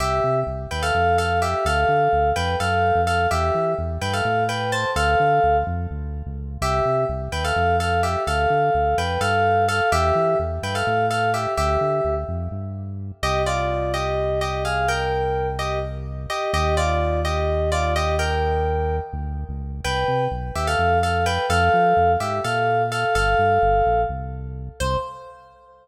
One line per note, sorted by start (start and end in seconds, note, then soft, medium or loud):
0.00 0.20 C2 medium
0.00 0.40 G4 medium
0.00 0.40 E5 medium
0.24 0.44 C3 medium
0.47 0.67 C2 medium
0.71 0.92 D#2 medium
0.71 0.82 B4 medium
0.71 0.82 G5 medium
0.82 1.17 A4 medium
0.82 1.17 F5 medium
0.94 1.55 F2 medium
1.18 1.39 A4 medium
1.18 1.39 F5 medium
1.42 1.65 G4 medium
1.42 1.65 E5 medium
1.65 1.85 D2 loud
1.65 2.30 A4 medium
1.65 2.30 F5 medium
1.88 2.08 D3 medium
2.13 2.33 D2 medium
2.36 2.56 F2 medium
2.36 2.56 B4 medium
2.36 2.56 G5 medium
2.60 2.92 F#2 medium
2.60 3.01 A4 medium
2.60 3.01 F5 medium
2.95 3.27 F2 medium
3.07 3.26 A4 medium
3.07 3.26 F5 medium
3.31 3.51 E2 loud
3.31 3.73 G4 medium
3.31 3.73 E5 medium
3.55 3.75 E3 medium
3.78 3.98 E2 medium
4.01 4.22 G2 medium
4.01 4.13 B4 medium
4.01 4.13 G5 medium
4.13 4.44 A4 medium
4.13 4.44 F5 medium
4.25 4.85 A2 loud
4.49 4.70 B4 medium
4.49 4.70 G5 medium
4.72 4.91 C5 medium
4.72 4.91 A5 medium
4.96 5.16 D2 loud
4.96 5.57 A4 medium
4.96 5.57 F5 medium
5.20 5.40 D3 medium
5.44 5.64 D2 medium
5.67 5.87 F2 loud
5.91 6.23 D2 medium
6.26 6.58 C#2 medium
6.62 6.82 C2 loud
6.62 7.04 G4 medium
6.62 7.04 E5 medium
6.85 7.05 C3 medium
7.09 7.29 C2 medium
7.32 7.52 D#2 medium
7.32 7.43 B4 medium
7.32 7.43 G5 medium
7.44 7.76 A4 medium
7.44 7.76 F5 medium
7.56 8.16 F2 medium
7.80 8.01 A4 medium
7.80 8.01 F5 medium
8.03 8.23 G4 medium
8.03 8.23 E5 medium
8.27 8.47 D2 loud
8.27 8.96 A4 medium
8.27 8.96 F5 medium
8.50 8.70 D3 medium
8.75 8.95 D2 medium
8.98 9.18 F2 medium
8.98 9.20 B4 medium
8.98 9.20 G5 medium
9.21 9.81 G2 medium
9.21 9.65 A4 medium
9.21 9.65 F5 medium
9.68 9.89 A4 medium
9.68 9.89 F5 medium
9.92 10.12 E2 loud
9.92 10.38 G4 medium
9.92 10.38 E5 loud
10.15 10.35 E3 medium
10.39 10.59 E2 medium
10.63 10.83 G2 medium
10.63 10.75 B4 medium
10.63 10.75 G5 medium
10.75 11.06 A4 medium
10.75 11.06 F5 medium
10.87 11.47 A2 medium
11.10 11.30 A4 medium
11.10 11.30 F5 medium
11.34 11.53 G4 medium
11.34 11.53 E5 medium
11.57 11.78 D2 loud
11.57 12.15 G4 medium
11.57 12.15 E5 medium
11.81 12.01 D3 medium
12.05 12.25 D2 medium
12.28 12.48 F2 medium
12.51 13.12 G2 medium
13.22 16.27 C2 loud
13.22 13.42 G4 medium
13.22 13.42 D#5 loud
13.46 13.92 F4 medium
13.46 13.92 D5 medium
13.94 14.40 G4 medium
13.94 14.40 D#5 medium
14.41 14.63 G4 medium
14.41 14.63 D#5 medium
14.65 14.88 G#4 medium
14.65 14.88 F5 medium
14.88 15.48 A#4 medium
14.88 15.48 G5 medium
15.59 15.79 G4 medium
15.59 15.79 D#5 medium
16.30 16.51 G4 medium
16.30 16.51 D#5 medium
16.53 19.00 D#2 loud
16.53 16.75 G4 medium
16.53 16.75 D#5 medium
16.77 17.20 F4 medium
16.77 17.20 D5 medium
17.25 17.70 G4 medium
17.25 17.70 D#5 medium
17.72 17.94 F4 medium
17.72 17.94 D5 medium
17.96 18.15 G4 medium
17.96 18.15 D#5 medium
18.19 18.96 A#4 medium
18.19 18.96 G5 medium
19.13 19.45 D2 loud
19.49 19.81 C#2 medium
19.84 20.05 C2 medium
19.84 20.25 B4 medium
19.84 20.25 G5 medium
20.08 20.28 C3 medium
20.31 20.51 B1 medium
20.55 20.76 D#2 medium
20.55 20.67 G4 medium
20.55 20.67 E5 medium
20.67 20.98 A4 medium
20.67 20.98 F5 medium
20.78 21.39 F2 medium
21.03 21.24 A4 medium
21.03 21.24 F5 medium
21.26 21.46 B4 medium
21.26 21.46 G5 medium
21.50 21.70 F2 loud
21.50 22.12 A4 medium
21.50 22.12 F5 medium
21.74 21.94 F3 medium
21.97 22.17 F2 medium
22.20 22.40 G#2 medium
22.20 22.39 G4 medium
22.20 22.39 E5 medium
22.44 23.05 A#2 medium
22.44 22.82 A4 medium
22.44 22.82 F5 medium
22.92 23.14 A4 medium
22.92 23.14 F5 medium
23.15 23.35 G1 loud
23.15 24.01 A4 medium
23.15 24.01 F5 medium
23.39 23.59 G2 medium
23.62 23.82 G1 medium
23.86 24.06 A#1 medium
24.09 24.69 C2 medium
24.80 24.97 C2 loud
24.80 24.97 C5 loud